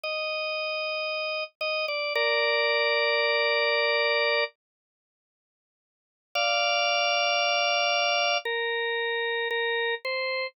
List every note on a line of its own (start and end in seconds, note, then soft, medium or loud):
0.04 1.44 D#5 medium
1.61 1.86 D#5 medium
1.88 2.13 D5 medium
2.15 4.44 A#4 medium
2.15 4.44 D5 medium
6.35 8.38 D5 medium
6.35 8.38 F5 medium
8.45 9.48 A#4 medium
9.50 9.95 A#4 medium
10.05 10.47 C5 medium